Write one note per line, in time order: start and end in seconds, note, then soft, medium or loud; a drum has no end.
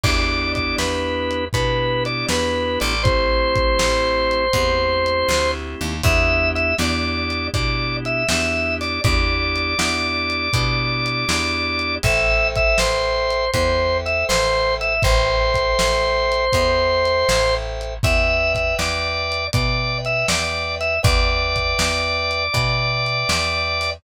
0.03 0.74 E2 medium
0.03 1.45 B3 medium
0.03 1.45 D4 loud
0.03 1.45 E4 medium
0.03 1.45 G4 medium
0.03 0.52 D5 medium
0.03 kick loud
0.03 crash loud
0.55 0.76 D5 medium
0.55 kick medium
0.55 closed hi-hat medium
0.78 1.49 E2 medium
0.78 1.45 B4 medium
0.78 snare loud
1.31 closed hi-hat medium
1.53 2.24 B2 medium
1.53 2.94 B3 medium
1.53 2.94 D4 medium
1.53 2.94 E4 medium
1.53 2.94 G4 medium
1.53 2.04 B4 loud
1.53 kick medium
1.53 closed hi-hat loud
2.05 2.26 D5 medium
2.05 closed hi-hat medium
2.28 2.78 E2 medium
2.28 2.79 B4 medium
2.28 snare loud
2.80 3.75 A1 medium
2.80 3.03 D5 medium
2.80 closed hi-hat medium
3.03 4.45 A3 loud
3.03 4.45 C4 medium
3.03 4.45 E4 medium
3.03 4.45 G4 medium
3.03 5.51 C5 medium
3.03 kick loud
3.03 closed hi-hat loud
3.55 kick medium
3.55 closed hi-hat medium
3.79 4.49 A1 medium
3.79 snare loud
4.31 closed hi-hat medium
4.53 5.24 E2 medium
4.53 5.94 A3 medium
4.53 5.94 C4 medium
4.53 5.94 E4 medium
4.53 5.94 G4 medium
4.53 kick medium
4.53 closed hi-hat loud
5.06 closed hi-hat medium
5.28 5.75 D2 medium
5.28 snare loud
5.81 6.02 D#2 medium
5.81 closed hi-hat medium
6.03 6.74 E2 medium
6.03 6.74 B3 medium
6.03 6.74 D4 medium
6.03 6.74 E4 medium
6.03 6.74 G4 medium
6.03 6.49 E5 loud
6.03 kick loud
6.03 closed hi-hat loud
6.55 6.75 E5 medium
6.55 closed hi-hat medium
6.78 7.49 E2 medium
6.78 7.50 B3 medium
6.78 7.50 D4 medium
6.78 7.50 E4 medium
6.78 7.50 G4 medium
6.78 7.48 D5 medium
6.78 snare loud
7.30 closed hi-hat medium
7.53 8.24 B2 medium
7.53 8.24 B3 medium
7.53 8.24 D4 medium
7.53 8.24 E4 medium
7.53 8.24 G4 medium
7.53 7.97 D5 medium
7.53 kick loud
7.53 closed hi-hat loud
8.05 8.27 E5 medium
8.05 closed hi-hat medium
8.28 8.99 E2 medium
8.28 9.00 B3 medium
8.28 9.00 D4 medium
8.28 9.00 E4 medium
8.28 9.00 G4 medium
8.28 8.75 E5 medium
8.28 snare loud
8.81 9.01 D5 medium
8.81 open hi-hat medium
9.04 9.75 E2 medium
9.04 9.74 B3 medium
9.04 9.74 D4 medium
9.04 9.74 E4 medium
9.04 9.74 G4 medium
9.04 11.95 D5 medium
9.04 kick loud
9.04 closed hi-hat loud
9.56 closed hi-hat medium
9.78 10.49 E2 medium
9.78 10.48 B3 medium
9.78 10.48 D4 medium
9.78 10.48 E4 medium
9.78 10.48 G4 medium
9.78 snare loud
10.30 closed hi-hat medium
10.53 11.24 B2 medium
10.53 11.25 B3 medium
10.53 11.25 D4 medium
10.53 11.25 E4 medium
10.53 11.25 G4 medium
10.53 kick medium
10.53 closed hi-hat loud
11.06 closed hi-hat medium
11.28 11.99 E2 medium
11.28 11.98 B3 medium
11.28 11.98 D4 medium
11.28 11.98 E4 medium
11.28 11.98 G4 medium
11.28 snare loud
11.79 closed hi-hat medium
12.03 12.74 A1 medium
12.03 13.45 A4 medium
12.03 13.45 C5 medium
12.03 12.48 E5 loud
12.03 13.45 E5 loud
12.03 13.45 G5 medium
12.03 kick loud
12.03 closed hi-hat loud
12.55 12.78 E5 loud
12.55 kick medium
12.55 closed hi-hat medium
12.78 13.49 A1 medium
12.78 13.51 C5 medium
12.78 snare loud
13.30 closed hi-hat medium
13.53 14.24 E2 medium
13.53 14.94 A4 medium
13.53 14.94 C5 medium
13.53 13.98 C5 medium
13.53 14.94 E5 medium
13.53 14.94 G5 medium
13.53 kick medium
13.53 closed hi-hat loud
14.06 14.25 E5 medium
14.06 closed hi-hat medium
14.29 14.99 A1 medium
14.29 14.75 C5 loud
14.29 snare loud
14.81 15.02 E5 medium
14.81 closed hi-hat medium
15.02 15.74 A1 medium
15.02 16.45 A4 medium
15.02 17.55 C5 loud
15.02 16.45 C5 medium
15.02 16.45 E5 medium
15.02 16.45 G5 medium
15.02 kick loud
15.02 closed hi-hat loud
15.54 kick medium
15.54 closed hi-hat medium
15.79 16.50 A1 medium
15.79 snare loud
16.32 closed hi-hat medium
16.53 17.24 E2 medium
16.53 17.94 A4 medium
16.53 17.94 C5 medium
16.53 17.94 E5 medium
16.53 17.94 G5 medium
16.53 kick medium
16.53 closed hi-hat loud
17.05 closed hi-hat medium
17.29 17.99 A1 medium
17.29 snare loud
17.81 closed hi-hat medium
18.03 18.74 E2 medium
18.03 19.45 B4 medium
18.03 19.45 D5 medium
18.03 19.45 E5 medium
18.03 18.53 E5 medium
18.03 19.45 G5 medium
18.03 kick loud
18.03 closed hi-hat loud
18.55 18.75 E5 medium
18.55 kick medium
18.55 closed hi-hat medium
18.79 19.49 E2 medium
18.79 19.47 D5 medium
18.79 snare loud
19.32 closed hi-hat medium
19.53 20.24 B2 medium
19.53 20.95 B4 medium
19.53 19.98 D5 medium
19.53 20.95 D5 medium
19.53 20.95 E5 medium
19.53 20.95 G5 medium
19.53 kick loud
19.53 closed hi-hat loud
20.05 20.27 E5 medium
20.05 closed hi-hat medium
20.28 20.99 E2 medium
20.28 20.75 D5 medium
20.28 snare loud
20.81 21.00 E5 medium
20.81 closed hi-hat medium
21.03 21.74 E2 medium
21.03 22.44 B4 loud
21.03 22.44 D5 medium
21.03 23.90 D5 medium
21.03 22.44 E5 medium
21.03 22.44 G5 medium
21.03 kick loud
21.03 closed hi-hat loud
21.56 kick medium
21.56 closed hi-hat medium
21.79 22.49 E2 medium
21.79 snare loud
22.31 closed hi-hat medium
22.53 23.24 B2 medium
22.53 23.94 B4 medium
22.53 23.94 D5 medium
22.53 23.94 E5 medium
22.53 23.94 G5 medium
22.53 kick medium
22.53 closed hi-hat loud
23.06 closed hi-hat medium
23.29 23.99 E2 medium
23.29 snare loud
23.81 open hi-hat medium